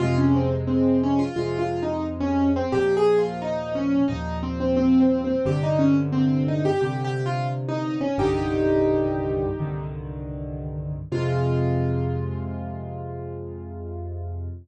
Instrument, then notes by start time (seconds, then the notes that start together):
acoustic grand piano
0.00 F2 C3 G#3 F4
0.18 C#4
0.35 C4
0.67 C4
1.03 C#4
1.19 F4
1.36 F2 C3 G#3 F4
1.59 F4
1.83 D#4
2.20 C#4
2.56 C4
2.72 D#2 A#2 F3 G4
2.97 G#4
3.18 F4
3.42 D#4
3.75 C#4
4.08 D#2 A#2 F3 D#4
4.43 C4
4.60 C4
4.77 C4
5.00 C4
5.24 C4
5.45 G2 C3 D3 G4
5.63 D#4
5.79 C#4
6.12 C4
6.48 D#4
6.65 G4
6.81 G2 C3 D3 G4
7.05 G4
7.26 F4
7.68 D#4
8.01 C#4
8.18 C2 G2 D3 D#3 D#4 G4
9.59 C2 G2 D3 D#3
11.12 F2 C3 G#3 F4